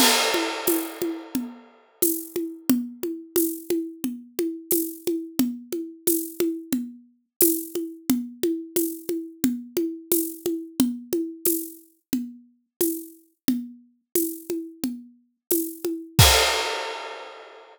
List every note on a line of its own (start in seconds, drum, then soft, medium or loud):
0.00 crash loud
0.00 low conga medium
0.34 high conga medium
0.67 tambourine medium
0.67 high conga medium
1.02 high conga medium
1.35 low conga medium
2.02 tambourine medium
2.02 high conga medium
2.36 high conga medium
2.70 low conga loud
3.03 high conga medium
3.36 tambourine medium
3.36 high conga medium
3.70 high conga medium
4.04 low conga medium
4.39 high conga medium
4.71 tambourine medium
4.71 high conga medium
5.07 high conga medium
5.39 low conga medium
5.72 high conga medium
6.07 tambourine medium
6.07 high conga medium
6.40 high conga medium
6.72 low conga medium
7.41 tambourine medium
7.41 high conga medium
7.75 high conga medium
8.10 low conga medium
8.43 high conga medium
8.76 tambourine medium
8.76 high conga medium
9.09 high conga medium
9.44 low conga medium
9.77 high conga medium
10.12 tambourine medium
10.12 high conga medium
10.46 high conga medium
10.80 low conga medium
11.13 high conga medium
11.45 tambourine medium
11.45 high conga medium
12.13 low conga medium
12.81 tambourine medium
12.81 high conga medium
13.48 low conga medium
14.15 tambourine medium
14.15 high conga medium
14.50 high conga medium
14.84 low conga medium
15.51 tambourine medium
15.51 high conga medium
15.85 high conga medium
16.19 kick loud
16.19 crash loud